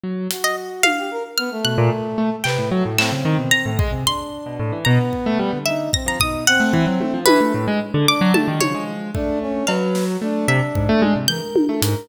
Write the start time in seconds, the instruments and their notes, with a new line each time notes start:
0.04 acoustic grand piano F#3
0.31 brass section F#4, closed hi-hat
0.44 orchestral harp D#5
0.83 orchestral harp F5, high tom
0.98 brass section G4
1.11 brass section A#4
1.38 brass section B3, orchestral harp F6
1.51 brass section A3
1.65 acoustic grand piano B2, orchestral harp F#6
1.78 acoustic grand piano A#2
2.18 acoustic grand piano A3
2.44 acoustic grand piano C3, brass section B4, orchestral harp G5, clap
2.58 acoustic grand piano A2
2.71 acoustic grand piano F#3, brass section A3
2.85 acoustic grand piano A2
2.98 acoustic grand piano A2, brass section C4, orchestral harp E6, clap
3.12 acoustic grand piano C#3
3.25 acoustic grand piano D#3, cowbell
3.39 acoustic grand piano B2
3.51 orchestral harp A#5
3.66 acoustic grand piano A2
3.79 acoustic grand piano G#3, brass section G#4, kick
3.92 acoustic grand piano C3
4.06 brass section D4, orchestral harp C6
4.46 acoustic grand piano B2
4.59 acoustic grand piano A2
4.72 acoustic grand piano E3
4.85 acoustic grand piano B2, brass section B3, orchestral harp A#5
5.13 kick
5.26 acoustic grand piano A3
5.39 acoustic grand piano G3
5.53 acoustic grand piano D3
5.66 brass section D#4, orchestral harp E5
5.93 brass section C4, orchestral harp A#6, kick
6.06 acoustic grand piano F3, orchestral harp A#5
6.20 acoustic grand piano B2, brass section D#4, orchestral harp D#6, kick
6.47 brass section C4, orchestral harp F#5
6.60 acoustic grand piano A3
6.73 acoustic grand piano E3, kick
6.87 acoustic grand piano F#3
7.00 acoustic grand piano A3, high tom
7.14 acoustic grand piano F3
7.26 acoustic grand piano E3, orchestral harp B4, high tom
7.41 acoustic grand piano A3
7.54 acoustic grand piano A2
7.68 acoustic grand piano G#3
7.94 acoustic grand piano D3
8.07 brass section D4, orchestral harp D6
8.21 acoustic grand piano F#3
8.34 brass section G3, acoustic grand piano A3, orchestral harp A5, high tom
8.48 acoustic grand piano D#3
8.61 acoustic grand piano C#3, brass section F3, orchestral harp C#5, high tom
8.75 acoustic grand piano G#3
9.15 acoustic grand piano A3, brass section D4, kick
9.41 brass section C#4
9.67 acoustic grand piano F#3, brass section B4, orchestral harp F5, cowbell
9.95 snare
10.08 brass section F#3
10.22 acoustic grand piano A3, brass section D4
10.48 acoustic grand piano C3, orchestral harp E5
10.75 acoustic grand piano G#2, kick
10.89 acoustic grand piano A3
11.02 acoustic grand piano G#3, high tom
11.16 acoustic grand piano C3
11.28 acoustic grand piano E3, brass section A#4, orchestral harp G6
11.56 high tom
11.69 acoustic grand piano A3, brass section A4
11.82 acoustic grand piano G#2, brass section A#4, closed hi-hat